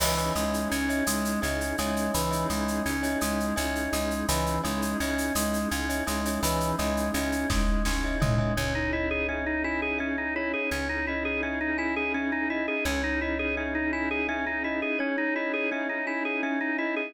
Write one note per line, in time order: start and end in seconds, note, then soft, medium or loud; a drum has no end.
0.00 0.31 C#2 medium
0.00 0.33 E3 medium
0.00 2.11 C#4 medium
0.00 2.11 D#4 medium
0.00 2.11 E4 medium
0.00 2.11 G#4 medium
0.00 0.14 C#5 medium
0.00 0.14 D#5 medium
0.00 0.14 E5 medium
0.00 0.14 G#5 medium
0.00 crash loud
0.18 0.75 C#5 medium
0.18 0.75 D#5 medium
0.18 0.75 E5 medium
0.18 0.75 G#5 medium
0.18 shaker medium
0.35 0.66 C#2 medium
0.35 0.68 G#3 medium
0.35 shaker medium
0.54 shaker medium
0.71 1.02 C#2 medium
0.71 1.04 C#4 medium
0.71 shaker medium
0.89 1.32 C#5 medium
0.89 1.32 D#5 medium
0.89 1.32 E5 medium
0.89 1.32 G#5 medium
0.89 shaker medium
1.07 1.37 C#2 medium
1.07 1.40 G#3 medium
1.07 shaker loud
1.25 shaker medium
1.42 1.73 C#2 medium
1.42 1.76 C#4 medium
1.42 1.76 C#5 medium
1.42 1.76 D#5 medium
1.42 1.76 E5 medium
1.42 1.76 G#5 medium
1.42 shaker medium
1.61 shaker medium
1.78 2.09 C#2 medium
1.78 2.11 G#3 medium
1.78 2.29 C#5 medium
1.78 2.29 D#5 medium
1.78 2.29 E5 medium
1.78 2.29 G#5 medium
1.78 shaker medium
1.96 shaker medium
2.14 2.45 C#2 medium
2.14 2.47 E3 medium
2.14 4.26 C#4 medium
2.14 4.26 D#4 medium
2.14 4.26 E4 medium
2.14 4.26 G#4 medium
2.14 shaker loud
2.31 2.88 C#5 medium
2.31 2.88 D#5 medium
2.31 2.88 E5 medium
2.31 2.88 G#5 medium
2.31 shaker medium
2.50 2.80 C#2 medium
2.50 2.83 G#3 medium
2.50 shaker medium
2.68 shaker medium
2.86 3.16 C#2 medium
2.86 3.19 C#4 medium
2.86 shaker medium
3.03 3.46 C#5 medium
3.03 3.46 D#5 medium
3.03 3.46 E5 medium
3.03 3.46 G#5 medium
3.03 shaker medium
3.21 3.52 C#2 medium
3.21 3.54 G#3 medium
3.21 shaker loud
3.40 shaker medium
3.56 3.88 C#2 medium
3.56 3.90 C#4 medium
3.56 4.13 C#5 medium
3.56 4.13 D#5 medium
3.56 4.13 E5 medium
3.56 4.13 G#5 medium
3.56 shaker medium
3.75 shaker medium
3.93 4.23 C#2 medium
3.93 4.26 G#3 medium
3.93 shaker medium
4.11 shaker medium
4.28 4.59 C#2 medium
4.28 4.61 E3 medium
4.28 6.40 C#4 medium
4.28 6.40 D#4 medium
4.28 6.40 E4 medium
4.28 6.40 G#4 medium
4.28 4.57 C#5 medium
4.28 4.57 D#5 medium
4.28 4.57 E5 medium
4.28 4.57 G#5 medium
4.28 shaker loud
4.46 shaker medium
4.64 4.95 C#2 medium
4.64 4.97 G#3 medium
4.64 4.92 C#5 medium
4.64 4.92 D#5 medium
4.64 4.92 E5 medium
4.64 4.92 G#5 medium
4.64 shaker medium
4.82 shaker medium
5.00 5.31 C#2 medium
5.00 5.33 C#4 medium
5.00 5.58 C#5 medium
5.00 5.58 D#5 medium
5.00 5.58 E5 medium
5.00 5.58 G#5 medium
5.00 shaker medium
5.18 shaker medium
5.35 5.65 C#2 medium
5.35 5.68 G#3 medium
5.35 shaker loud
5.53 shaker medium
5.71 6.02 C#2 medium
5.71 6.04 C#4 medium
5.71 shaker medium
5.89 6.03 C#5 medium
5.89 6.03 D#5 medium
5.89 6.03 E5 medium
5.89 6.03 G#5 medium
5.89 shaker medium
6.07 6.38 C#2 medium
6.07 6.40 G#3 medium
6.07 6.21 C#5 medium
6.07 6.21 D#5 medium
6.07 6.21 E5 medium
6.07 6.21 G#5 medium
6.07 shaker medium
6.25 6.40 C#5 medium
6.25 6.40 D#5 soft
6.25 6.40 E5 medium
6.25 6.40 G#5 medium
6.25 shaker medium
6.42 6.73 C#2 medium
6.42 6.76 E3 medium
6.42 8.54 C#4 medium
6.42 8.54 D#4 medium
6.42 8.54 E4 medium
6.42 8.54 G#4 medium
6.42 6.71 C#5 medium
6.42 6.71 D#5 medium
6.42 6.71 E5 medium
6.42 6.71 G#5 medium
6.42 shaker loud
6.60 shaker medium
6.78 7.10 C#2 medium
6.78 7.11 G#3 medium
6.78 7.08 C#5 medium
6.78 7.08 D#5 medium
6.78 7.08 E5 medium
6.78 7.08 G#5 medium
6.78 shaker medium
6.97 shaker medium
7.14 7.44 C#2 medium
7.14 7.47 C#4 medium
7.14 7.71 C#5 medium
7.14 7.71 D#5 medium
7.14 7.71 E5 medium
7.14 7.71 G#5 medium
7.14 shaker medium
7.32 shaker medium
7.50 7.81 C#2 medium
7.50 7.83 G#3 medium
7.50 kick medium
7.50 snare medium
7.85 8.16 C#2 medium
7.85 8.18 C#4 medium
7.85 snare medium
8.04 8.18 C#5 medium
8.04 8.18 D#5 medium
8.04 8.18 E5 medium
8.04 8.18 G#5 medium
8.20 8.52 C#2 medium
8.20 8.54 G#3 medium
8.20 8.34 C#5 medium
8.20 8.34 D#5 medium
8.20 8.34 E5 medium
8.20 8.34 G#5 medium
8.20 floor tom loud
8.38 8.53 C#5 medium
8.38 8.53 D#5 medium
8.38 8.53 E5 medium
8.38 8.53 G#5 medium
8.57 10.54 C#2 medium
8.57 10.69 C#4 medium
8.57 8.74 C#4 medium
8.57 10.69 D#4 medium
8.57 10.69 E4 medium
8.57 10.69 G#4 medium
8.57 10.36 C#5 medium
8.75 8.91 D#4 medium
8.93 9.09 E4 medium
8.93 10.62 D#5 medium
9.11 9.27 G#4 medium
9.29 9.45 C#4 medium
9.29 9.98 E5 medium
9.46 9.63 D#4 medium
9.64 9.81 E4 medium
9.64 10.66 G#5 medium
9.82 9.99 G#4 medium
9.99 10.16 C#4 medium
9.99 10.66 E5 medium
10.18 10.34 D#4 medium
10.36 10.52 E4 medium
10.36 12.75 C#5 medium
10.54 10.70 G#4 medium
10.71 12.69 C#2 medium
10.71 12.84 C#4 medium
10.71 10.88 C#4 medium
10.71 12.84 D#4 medium
10.71 12.84 E4 medium
10.71 12.84 G#4 medium
10.89 11.06 D#4 medium
11.07 11.24 E4 medium
11.07 12.50 D#5 medium
11.25 11.41 G#4 medium
11.43 11.59 C#4 medium
11.43 12.14 E5 medium
11.61 11.77 D#4 medium
11.78 11.95 E4 medium
11.78 12.80 G#5 medium
11.96 12.13 G#4 medium
12.14 12.31 C#4 medium
12.14 12.82 E5 medium
12.32 12.49 D#4 medium
12.50 12.66 E4 medium
12.50 12.84 D#5 medium
12.68 12.84 G#4 medium
12.85 14.82 C#2 medium
12.85 14.97 C#4 medium
12.85 13.02 C#4 medium
12.85 14.97 D#4 medium
12.85 14.97 E4 medium
12.85 14.97 G#4 medium
12.85 14.88 C#5 medium
13.04 13.20 D#4 medium
13.21 13.38 E4 medium
13.21 14.64 D#5 medium
13.39 13.56 G#4 medium
13.57 13.74 C#4 medium
13.57 14.28 E5 medium
13.75 13.91 D#4 medium
13.93 14.09 E4 medium
13.93 14.95 G#5 medium
14.11 14.27 G#4 medium
14.29 14.45 C#4 medium
14.29 14.96 E5 medium
14.46 14.63 D#4 medium
14.64 14.81 E4 medium
14.64 14.98 D#5 medium
14.82 14.99 G#4 medium
14.99 15.16 C#4 medium
14.99 17.13 C#4 medium
14.99 17.13 D#4 medium
14.99 17.13 E4 medium
14.99 17.13 G#4 medium
14.99 17.02 C#5 medium
15.18 15.34 D#4 medium
15.36 15.52 E4 medium
15.36 16.78 D#5 medium
15.54 15.70 G#4 medium
15.71 15.88 C#4 medium
15.71 16.43 E5 medium
15.89 16.06 D#4 medium
16.07 16.24 E4 medium
16.07 17.09 G#5 medium
16.25 16.41 G#4 medium
16.43 16.59 C#4 medium
16.43 17.11 E5 medium
16.61 16.77 D#4 medium
16.78 16.95 E4 medium
16.78 17.12 D#5 medium
16.96 17.13 G#4 medium